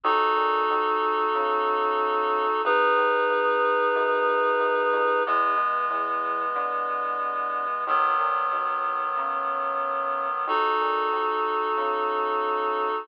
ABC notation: X:1
M:4/4
L:1/8
Q:1/4=92
K:E
V:1 name="Clarinet"
[DFA]8 | [DGB]8 | [E,G,B,]8 | [D,F,B,]8 |
[DFA]8 |]
V:2 name="Synth Bass 1" clef=bass
D,, ^A,, D,,2 C,4 | G,,, D,, G,,,2 F,,2 F,, =F,, | E,, B,, E,,2 =D,4 | D,, ^A,, D,,2 C,4 |
D,, ^A,, D,,2 C,4 |]